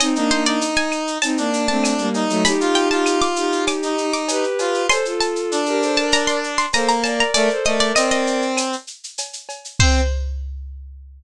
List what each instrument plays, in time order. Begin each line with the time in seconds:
0.00 violin C4 D#4, harpsichord D#5, cowbell, claves, shaker
0.15 violin A#3 D4, lead 1 (square) D#4, shaker
0.30 violin A#3 D4, harpsichord C5, shaker
0.45 lead 1 (square) D#4, harpsichord D5, shaker
0.61 shaker
0.76 harpsichord G#5, shaker
0.92 claves, shaker
1.07 shaker
1.22 violin C4 D#4, harpsichord A5, cowbell, shaker
1.37 violin A#3 D4, lead 1 (square) D4, shaker
1.53 shaker
1.68 violin A3 C4, harpsichord A5, shaker
1.83 cowbell, claves, shaker
1.98 violin G3 A#3, shaker
2.14 lead 1 (square) D#4, cowbell, shaker
2.29 violin F#3 A3, shaker
2.45 violin D#4 G4, harpsichord B5, cowbell, shaker
2.60 lead 1 (square) F4, shaker
2.75 harpsichord G5, shaker
2.91 lead 1 (square) F4, harpsichord A5, shaker
3.06 claves, shaker
3.22 harpsichord D6, shaker
3.36 violin D#4 G4, shaker
3.52 shaker
3.67 harpsichord D6, cowbell, claves, shaker
3.83 lead 1 (square) D#4, shaker
3.98 shaker
4.13 harpsichord D6, shaker
4.28 violin G4 B4, cowbell, shaker
4.44 shaker
4.59 lead 1 (square) F4, cowbell, shaker
4.74 shaker
4.89 violin A4 C5, harpsichord C6, cowbell, claves, shaker
5.05 violin F4 A4, shaker
5.21 harpsichord A5, shaker
5.36 shaker
5.51 lead 1 (square) D4, shaker
5.66 violin G4 A#4, shaker
5.81 violin A4 C5, shaker
5.96 violin A#4 D5, harpsichord A5, shaker
6.12 harpsichord A#5, cowbell, shaker
6.27 harpsichord C6, shaker
6.44 shaker
6.58 harpsichord C6, shaker
6.73 lead 1 (square) A#3, violin A4 C5, harpsichord A#5, cowbell, claves, shaker
6.88 harpsichord A#5, shaker
7.04 violin A#4 D5, harpsichord A5, cowbell, shaker
7.20 harpsichord A#5, shaker
7.34 lead 1 (square) A3, violin A#4 D5, harpsichord D5, cowbell, shaker
7.50 violin A4 C5, shaker
7.65 lead 1 (square) A3, violin A#4 D5, harpsichord D#5, shaker
7.80 harpsichord D5, shaker
7.95 lead 1 (square) C4, harpsichord D#5, claves, shaker
8.11 harpsichord D#5, shaker
8.27 shaker
8.42 shaker
8.57 cowbell, claves, shaker
8.73 shaker
8.87 shaker
9.04 shaker
9.18 cowbell, shaker
9.33 shaker
9.49 cowbell, shaker
9.65 shaker
9.79 lead 1 (square) C4, violin C5, harpsichord C5, kick, crash